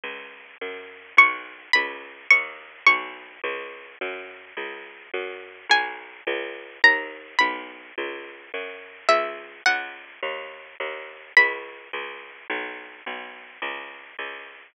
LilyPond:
<<
  \new Staff \with { instrumentName = "Pizzicato Strings" } { \time 6/8 \key cis \dorian \tempo 4. = 106 r2. | cis'''4. b''4. | cis'''4. cis'''4. | r2. |
r2. | gis''2. | ais''4. b''4. | r2. |
e''4. fis''4. | r2. | b''2. | r2. |
r2. | }
  \new Staff \with { instrumentName = "Electric Bass (finger)" } { \clef bass \time 6/8 \key cis \dorian cis,4. fis,4. | b,,4. cis,4. | dis,4. b,,4. | cis,4. fis,4. |
cis,4. fis,4. | b,,4. cis,4. | dis,4. b,,4. | cis,4. fis,4. |
cis,4. cis,4. | dis,4. dis,4. | cis,4. cis,4. | b,,4. b,,4. |
cis,4. cis,4. | }
>>